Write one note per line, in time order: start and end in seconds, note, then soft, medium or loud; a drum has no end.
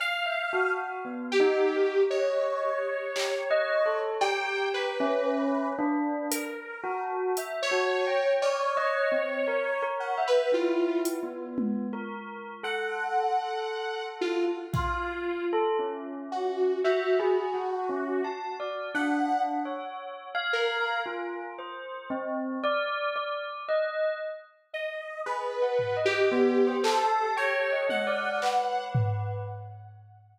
0.00 0.71 F5 loud
0.00 cowbell medium
0.26 0.49 E5 medium
0.53 1.00 F#4 medium
1.05 1.36 B3 soft
1.32 2.03 G4 loud
1.40 1.71 D#4 loud
1.76 2.07 A#4 soft
2.10 4.00 C#5 medium
2.10 3.05 D#5 medium
3.16 3.48 G4 medium
3.16 clap loud
3.51 3.82 D#5 loud
3.86 4.17 A4 medium
4.21 4.92 G4 medium
4.21 4.68 G5 medium
4.21 cowbell loud
4.74 5.69 B4 medium
5.00 5.71 C#4 loud
5.79 6.26 D4 loud
6.31 7.02 A#4 medium
6.31 closed hi-hat medium
6.84 7.31 F#4 loud
7.37 7.69 E5 medium
7.37 closed hi-hat medium
7.62 8.33 C#5 loud
7.71 8.03 F#4 medium
8.07 8.39 G5 medium
8.42 9.84 C#5 loud
8.42 8.74 D5 medium
8.42 cowbell medium
8.77 9.09 D#5 loud
9.12 9.43 C4 medium
9.47 9.79 A#4 medium
9.82 10.14 A#4 medium
10.00 10.23 F#5 medium
10.18 10.49 E5 medium
10.27 10.51 B4 loud
10.52 11.15 E4 medium
10.52 11.01 F4 medium
11.05 closed hi-hat medium
11.23 11.86 B3 medium
11.58 high tom loud
11.93 12.56 A#4 medium
12.63 14.53 A4 medium
12.63 14.06 F#5 medium
14.21 14.45 F4 medium
14.73 15.45 F4 medium
14.73 15.44 F5 medium
14.73 kick medium
15.53 15.76 A4 loud
15.79 16.74 C#4 medium
16.32 16.79 F#4 medium
16.84 18.27 F#4 medium
16.84 17.16 E5 medium
17.20 17.51 G#4 loud
17.54 17.86 F#4 medium
17.89 18.21 C#4 medium
18.24 18.56 A5 medium
18.60 18.91 D5 medium
18.94 19.58 D4 medium
18.94 19.42 F#5 medium
19.65 20.29 C#5 medium
20.35 20.98 F5 loud
20.53 21.00 A#4 medium
21.06 21.53 F4 medium
21.59 22.06 C5 medium
22.10 22.58 C4 loud
22.64 23.11 D5 loud
23.16 23.63 D5 medium
23.69 24.16 D#5 medium
24.73 25.21 D#5 medium
25.26 25.58 G#4 medium
25.26 25.97 B4 medium
25.62 25.94 F#5 medium
25.79 floor tom medium
25.97 26.28 D#5 medium
26.05 26.76 G4 loud
26.32 26.63 B3 loud
26.67 26.99 C5 loud
26.83 27.31 A4 loud
26.83 clap loud
27.01 27.33 A5 medium
27.37 27.84 C#5 loud
27.37 27.68 G5 medium
27.72 28.04 D#5 medium
27.89 28.84 F#5 medium
27.89 high tom medium
28.07 28.38 D5 medium
28.42 29.37 B4 medium
28.42 clap medium
28.95 floor tom loud